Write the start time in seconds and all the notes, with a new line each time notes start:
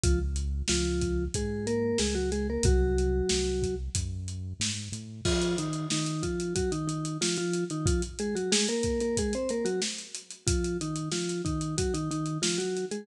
0.04 C#2 F3 F4, kick, closed hi-hat
0.36 closed hi-hat
0.68 C#2 F3 F4, snare
1.01 kick, closed hi-hat
1.34 G#2 G#3 G#4, kick, closed hi-hat
1.67 A#3 A#4, closed hi-hat
1.98 C#2 G#3 G#4, snare
2.15 F#3 F#4
2.32 G#3 G#4, closed hi-hat
2.50 A#3 A#4
2.63 C2 F#3 F#4, kick, closed hi-hat
2.98 closed hi-hat
3.29 C2, snare
3.62 kick, closed hi-hat
3.95 F#2, kick, closed hi-hat
4.28 closed hi-hat
4.60 G#2, snare
4.92 A2, closed hi-hat
5.25 F3 F4, kick, crash
5.42 closed hi-hat
5.58 D#3 D#4, closed hi-hat
5.73 closed hi-hat
5.90 D#3 D#4, snare
6.06 closed hi-hat
6.23 F3 F4, kick, closed hi-hat
6.40 closed hi-hat
6.55 F#3 F#4, kick, closed hi-hat
6.72 D#3 D#4, closed hi-hat
6.88 D#3 D#4, closed hi-hat
7.05 closed hi-hat
7.21 F3 F4, snare
7.37 F3 F4, closed hi-hat
7.53 closed hi-hat
7.70 D#3 D#4, closed hi-hat
7.86 F3 F4, kick, closed hi-hat
8.02 closed hi-hat
8.19 G#3 G#4, closed hi-hat
8.35 F#3 F#4, closed hi-hat
8.52 G#3 G#4, snare
8.68 A#3 A#4, closed hi-hat
8.83 kick, closed hi-hat
9.00 A#3 A#4, closed hi-hat
9.17 G#3 G#4, kick, closed hi-hat
9.33 C4 C5, closed hi-hat
9.49 A#3 A#4, closed hi-hat
9.65 F#3 F#4, closed hi-hat
9.82 snare
9.98 closed hi-hat
10.15 closed hi-hat
10.30 closed hi-hat
10.47 F3 F4, kick, closed hi-hat
10.64 closed hi-hat
10.81 D#3 D#4, closed hi-hat
10.96 closed hi-hat
11.12 F3 F4, snare
11.29 closed hi-hat
11.45 D#3 D#4, kick, closed hi-hat
11.61 closed hi-hat
11.78 F#3 F#4, kick, closed hi-hat
11.94 D#3 D#4, closed hi-hat
12.11 D#3 D#4, closed hi-hat
12.26 closed hi-hat
12.42 F3 F4, snare
12.58 F#3 F#4, closed hi-hat
12.77 closed hi-hat
12.91 G#3 G#4, closed hi-hat